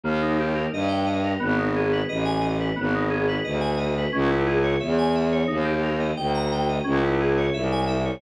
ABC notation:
X:1
M:4/4
L:1/16
Q:1/4=88
K:G#m
V:1 name="Electric Piano 2"
A, D =G A d =g d A B, D ^G B d ^g d B | B, D G B d g d B C E G c e g e c | D =G A d =g a g d C E ^G c e ^g e c |]
V:2 name="Violin" clef=bass
D,,4 =G,,4 ^G,,,4 =A,,,4 | G,,,4 =D,,4 C,,4 E,,4 | D,,4 =D,,4 C,,4 =C,,4 |]